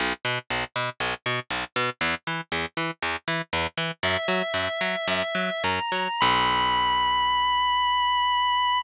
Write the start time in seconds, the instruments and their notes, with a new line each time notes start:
0.00 electric bass (finger) B1
0.25 electric bass (finger) B2
0.50 electric bass (finger) B1
0.76 electric bass (finger) B2
1.00 electric bass (finger) B1
1.26 electric bass (finger) B2
1.50 electric bass (finger) B1
1.76 electric bass (finger) B2
2.01 electric bass (finger) E2
2.27 electric bass (finger) E3
2.52 electric bass (finger) E2
2.77 electric bass (finger) E3
3.02 electric bass (finger) E2
3.28 electric bass (finger) E3
3.53 electric bass (finger) E2
3.77 electric bass (finger) E3
4.03 electric bass (finger) F#2, drawbar organ E5
4.28 electric bass (finger) F#3
4.54 electric bass (finger) F#2
4.81 electric bass (finger) F#3
5.08 electric bass (finger) F#2
5.35 electric bass (finger) F#3
5.64 electric bass (finger) F#2, drawbar organ A#5
5.92 electric bass (finger) F#3
6.20 electric bass (finger) B1, drawbar organ B5